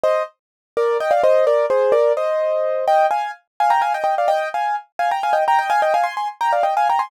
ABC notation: X:1
M:6/8
L:1/16
Q:3/8=85
K:Eb
V:1 name="Acoustic Grand Piano"
[ce]2 z4 [Bd]2 [eg] [df] [ce]2 | [Bd]2 [Ac]2 [Bd]2 [ce]6 | [eg]2 [fa]2 z2 [fa] [gb] [fa] [eg] [eg] [df] | [eg]2 [fa]2 z2 [fa] [gb] [fa] [eg] [gb] [eg] |
[fa] [eg] [fa] [ac'] [ac'] z [gb] [df] [eg] [fa] [gb] [ac'] |]